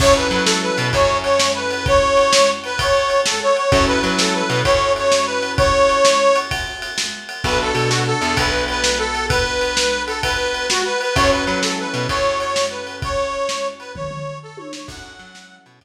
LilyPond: <<
  \new Staff \with { instrumentName = "Harmonica" } { \time 12/8 \key fis \minor \tempo 4. = 129 cis''8 b'8 b'8 a'8 b'4 cis''4 cis''4 b'4 | cis''2~ cis''8 b'8 cis''4. a'8 cis''8 cis''8 | cis''8 b'8 b'8 a'8 b'4 cis''4 cis''4 b'4 | cis''2. r2. |
b'8 a'8 a'8 fis'8 a'4 b'4 b'4 a'4 | b'2~ b'8 a'8 b'4. fis'8 b'8 b'8 | cis''8 b'8 b'8 a'8 b'4 cis''4 cis''4 b'4 | cis''2~ cis''8 b'8 cis''4. a'8 cis''8 cis''8 |
fis''2~ fis''8 r2. r8 | }
  \new Staff \with { instrumentName = "Acoustic Grand Piano" } { \time 12/8 \key fis \minor <cis' e' fis' a'>1.~ | <cis' e' fis' a'>1. | <cis' e' fis' a'>1.~ | <cis' e' fis' a'>1. |
<b d' fis' a'>1.~ | <b d' fis' a'>1. | <cis' e' fis' a'>1.~ | <cis' e' fis' a'>1. |
<cis' e' fis' a'>1. | }
  \new Staff \with { instrumentName = "Electric Bass (finger)" } { \clef bass \time 12/8 \key fis \minor fis,4 fis4. b,8 fis,2.~ | fis,1. | fis,4 fis4. b,8 fis,2.~ | fis,1. |
b,,4 b,4. e,8 b,,2.~ | b,,1. | fis,4 fis4. b,8 fis,2.~ | fis,1. |
fis,4 fis4. b,8 fis,2. | }
  \new DrumStaff \with { instrumentName = "Drums" } \drummode { \time 12/8 <cymc bd>4 cymr8 sn4 cymr8 <bd cymr>4 cymr8 sn4 cymr8 | <bd cymr>4 cymr8 sn4 cymr8 <bd cymr>4 cymr8 sn4 cymr8 | <bd cymr>4 cymr8 sn4 cymr8 <bd cymr>4 cymr8 sn4 cymr8 | <bd cymr>4 cymr8 sn4 cymr8 <bd cymr>4 cymr8 sn4 cymr8 |
<bd cymr>4 cymr8 sn4 cymr8 <bd cymr>4 cymr8 sn4 cymr8 | <bd cymr>4 cymr8 sn4 cymr8 <bd cymr>4 cymr8 sn4 cymr8 | <bd cymr>4 cymr8 sn4 cymr8 <bd cymr>4 cymr8 sn4 cymr8 | <bd cymr>4 cymr8 sn4 cymr8 <bd tomfh>8 tomfh4 r8 tommh8 sn8 |
<cymc bd>4 cymr8 sn4 cymr8 <bd cymr>4. r4. | }
>>